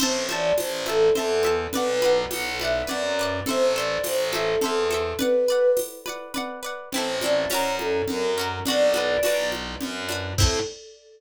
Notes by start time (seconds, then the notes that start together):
0.00 A1 C5 E5 A5, crash, low conga
0.29 C5 D5 E5 A5, high conga
0.58 A1 C5, tambourine, high conga
0.86 A4 C5 E5 A5, high conga
1.15 E2 A4 C5 E5 A5, low conga
1.43 C5 E5 A5, high conga
1.73 B1 B4 D5, low conga
1.77 F#5
2.02 B4 D5 F#5, high conga
2.31 B1 F#5, tambourine, high conga
2.59 B4 D5 E5, high conga
2.65 F#5
2.87 F#2 B4 D5 F#5, low conga
3.19 B4 D5 F#5
3.46 A1 A4 C5, low conga
3.50 E5
3.74 A4 C5 D5
3.80 E5
4.04 A1 C5, tambourine, high conga
4.31 A4 C5, high conga
4.36 E5
4.61 E2 A4 C5, low conga
4.66 E5
4.91 A4 C5 E5, high conga
5.19 B4 D5 F#5, low conga
5.48 B4 D5 F#5
5.77 tambourine, high conga
6.06 B4 D5 F#5, high conga
6.34 B4 D5 F#5, low conga
6.63 B4 D5 F#5
6.91 A1 C4 C5, low conga
6.96 E4 A4
7.21 C4 E4 D5, high conga
7.26 A4
7.48 F#2 C#4 C#5, tambourine, high conga
7.53 F#4 A#4
7.79 A4, high conga
8.07 F#2 A#4, low conga
8.38 C#4 F#4 A#4
8.65 B1 D4 F#4 D5, low conga
8.70 B4
8.94 D4 F#4 B4, high conga
9.23 B1 D4 F#4 B4, tambourine, high conga
9.52 high conga
9.81 F#2, low conga
10.09 D4 F#4 B4, high conga
10.38 A2 C4 E4 A4, kick, crash